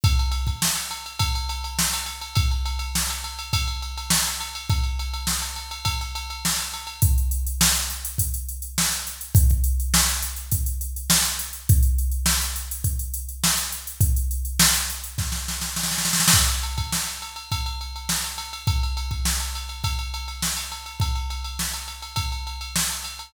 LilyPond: \new DrumStaff \drummode { \time 4/4 \tempo 4 = 103 <bd cymr>16 cymr16 cymr16 <bd cymr>16 sn16 cymr16 cymr16 cymr16 <bd cymr>16 cymr16 cymr16 cymr16 sn16 cymr16 cymr16 cymr16 | <bd cymr>16 cymr16 cymr16 cymr16 sn16 cymr16 cymr16 cymr16 <bd cymr>16 cymr16 cymr16 cymr16 sn16 cymr16 cymr16 cymr16 | <bd cymr>16 cymr16 cymr16 cymr16 sn16 cymr16 cymr16 cymr16 <bd cymr>16 cymr16 cymr16 cymr16 sn16 cymr16 cymr16 cymr16 | <hh bd>16 hh16 hh16 hh16 sn16 hh16 hh16 hh16 <hh bd>16 hh16 hh16 hh16 sn16 hh16 hh16 hh16 |
<hh bd>16 <hh bd>16 hh16 hh16 sn16 hh16 hh16 hh16 <hh bd>16 hh16 hh16 hh16 sn16 hh16 hh16 hh16 | <hh bd>16 hh16 hh16 hh16 sn16 hh16 hh16 hh16 <hh bd>16 hh16 hh16 hh16 sn16 hh16 hh16 hh16 | <hh bd>16 hh16 hh16 hh16 sn16 hh16 hh16 hh16 <bd sn>16 sn16 sn16 sn16 sn32 sn32 sn32 sn32 sn32 sn32 sn32 sn32 | <cymc bd>16 cymr16 cymr16 <bd cymr>16 sn16 cymr16 cymr16 cymr16 <bd cymr>16 cymr16 cymr16 cymr16 sn16 cymr16 cymr16 cymr16 |
<bd cymr>16 cymr16 cymr16 <bd cymr>16 sn16 cymr16 cymr16 cymr16 <bd cymr>16 cymr16 cymr16 cymr16 sn16 cymr16 cymr16 cymr16 | <bd cymr>16 cymr16 cymr16 cymr16 sn16 cymr16 cymr16 cymr16 <bd cymr>16 cymr16 cymr16 cymr16 sn16 cymr16 cymr16 cymr16 | }